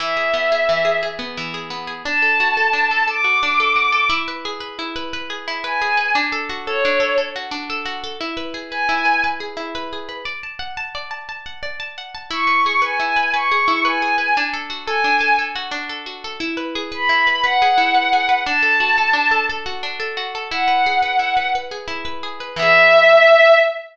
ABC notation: X:1
M:6/8
L:1/8
Q:3/8=117
K:Emix
V:1 name="Violin"
e6 | z6 | a6 | d'6 |
z6 | z3 g3 | z3 c3 | z6 |
z3 g3 | z6 | z6 | z6 |
c'3 g3 | c'3 g3 | z3 g3 | z6 |
z3 b3 | f6 | a6 | z6 |
f6 | z6 | e6 |]
V:2 name="Orchestral Harp"
E, G B, G E, G | G B, E, G B, G | D A F A D A | A F D A F A |
E B G B E B | B G E B G B | D A F A D A | A F D A F A |
E B G B E B | B G E B G B | d a f a d a | a f d a f a |
E B G B E B | B G E B G B | D A F A D A | A F D A F A |
E B G B E B | B G E B G B | D A F A D A | A F D A F A |
E B G B E B | B G E B G B | [E,B,G]6 |]